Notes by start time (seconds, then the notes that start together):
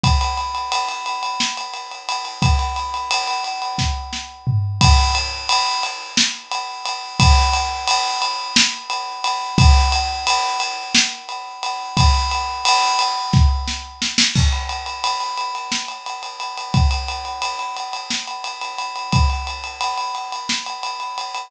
0.03 kick, ride
0.21 ride
0.37 ride
0.55 ride
0.72 ride
0.88 ride
1.06 ride
1.23 ride
1.40 snare
1.57 ride
1.73 ride
1.91 ride
2.09 ride
2.25 ride
2.42 kick, ride
2.59 ride
2.76 ride
2.94 ride
3.11 ride
3.27 ride
3.44 ride
3.62 ride
3.78 kick, snare
4.13 snare
4.47 floor tom
4.81 kick, ride
5.15 ride
5.49 ride
5.83 ride
6.17 snare
6.51 ride
6.85 ride
7.20 kick, ride
7.53 ride
7.87 ride
8.22 ride
8.56 snare
8.90 ride
9.24 ride
9.58 kick, ride
9.92 ride
10.27 ride
10.60 ride
10.94 snare
11.29 ride
11.63 ride
11.97 kick, ride
12.31 ride
12.65 ride
12.99 ride
13.33 kick, snare
13.67 snare
14.02 snare
14.18 snare
14.35 kick, crash
14.52 ride
14.69 ride
14.86 ride
15.04 ride
15.20 ride
15.37 ride
15.55 ride
15.72 snare
15.88 ride
16.06 ride
16.23 ride
16.40 ride
16.57 ride
16.74 kick, ride
16.91 ride
17.08 ride
17.25 ride
17.42 ride
17.59 ride
17.76 ride
17.93 ride
18.10 snare
18.27 ride
18.44 ride
18.61 ride
18.78 ride
18.96 ride
19.12 kick, ride
19.30 ride
19.47 ride
19.64 ride
19.81 ride
19.97 ride
20.15 ride
20.32 ride
20.49 snare
20.66 ride
20.83 ride
21.00 ride
21.18 ride
21.35 ride